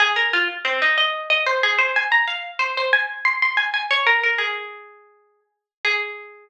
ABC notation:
X:1
M:12/8
L:1/8
Q:3/8=123
K:Abmix
V:1 name="Pizzicato Strings"
A B F z C E e2 e c A c | a b f z c c a2 c' c' a a | d B B A7 z2 | A12 |]